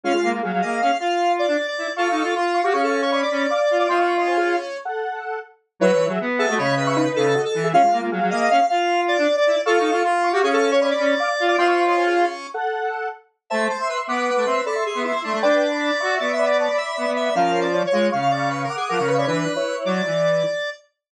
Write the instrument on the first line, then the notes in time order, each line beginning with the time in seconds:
lead 1 (square)
0.03 G#3 C#4 F4 F5
0.14 G#3 F4
0.23 A#3
0.33 A#3
0.43 F#3 G#4 F5
0.53 F#3
0.62 A#3 D#5
0.82 C#4 F5
1.00 F4 F5
1.39 D5
1.48 D4
1.67 D5
1.78 E4
1.96 F4 A4 F5 C#6
2.10 D#4
2.22 F4 F5 C#6
2.35 F4
2.54 F5 C#6
2.64 F#4 G4 F5 C#6
2.73 C#4 G#4 F5 C#6
2.83 A4
3.02 C#5 F5 C#6
3.12 C#5 D5 B5
3.22 D5
3.31 C#4
3.50 F5 D6
3.71 F4
3.79 D5 F5 D6
3.89 C4 F4 D#5 C6
3.98 C4 F5 C#6
4.17 C#4 D#5 C6
4.27 C5 G#5
4.37 G#4 F5
4.85 A4 F#5
5.79 F#3 E4 B4 C#5
5.94 E3
6.07 F#3 G#4 E5
6.20 B3
6.39 G#4 A4 E5
6.48 A3 F#4 D#5
6.58 C#3 C#5 D#5 B5
6.77 B4
6.87 E5 C#6
6.96 D#4 B4
7.16 C#3 A4
7.35 F#4 D#5
7.45 A4
7.54 E3
7.64 G#4 E5
7.73 G#3 C#4 F4 F5
7.83 G#3 F4
7.92 A#3
8.01 A#3
8.11 F#3 G#4 F5
8.21 F#3
8.31 A#3 D#5
8.50 C#4 F5
8.69 F4 F5
9.08 D5
9.18 D4
9.37 D5
9.47 E4
9.66 F4 A4 F5 C#6
9.79 D#4
9.91 F4 F5 C#6
10.04 F4
10.24 F5 C#6
10.33 F#4 G4 F5 C#6
10.42 C#4 G#4 F5 C#6
10.53 A4
10.71 C#5 F5 C#6
10.81 C#5 D5 B5
10.90 D5
10.99 C#4
11.20 F5 D6
11.40 F4
11.48 D5 F5 D6
11.58 C4 F4 D#5 C6
11.67 C4 F5 C#6
11.87 C#4 D#5 C6
11.97 C5 G#5
12.06 G#4 F5
12.54 A4 F#5
13.50 A3 C5 E5 A5
13.69 C5
13.79 E5 C6
13.89 B4
14.07 B3 B4 F#5 D6
14.36 A3
14.46 C4 E5 C6
14.66 A4 D5 B5
14.75 E5 C6
14.86 G#4
14.95 B3
15.04 E4 E5 C6
15.24 A3 D4
15.34 A3
15.42 D4 B4 D5 G5
15.71 D5 B5
16.00 F#4 E5 C#6
16.20 B3 D5
16.33 E5
16.39 D5 B5
16.45 D5
16.58 C#5 D5 A5
16.68 D5 B5
16.77 E5
16.97 B3 D5 B5
17.06 B3
17.16 E5
17.25 E5
17.35 F3 C#4 A#4 F5
17.61 D5
17.73 F4 C#5
17.87 C#5
17.92 G#3 F4 C#5
18.12 C#3 F5 C#6
18.21 F5
18.31 D5 F5 C#6
18.50 B4
18.64 A#4
18.70 F#5 D6
18.76 G#4
18.89 F3 A#4 F#5 D6
18.99 C#3 F5 C#6
19.07 B4
19.18 C#5 D5 B5
19.27 E3 D4 B4
19.56 E4 C#5
19.85 F#3 D5
20.06 E3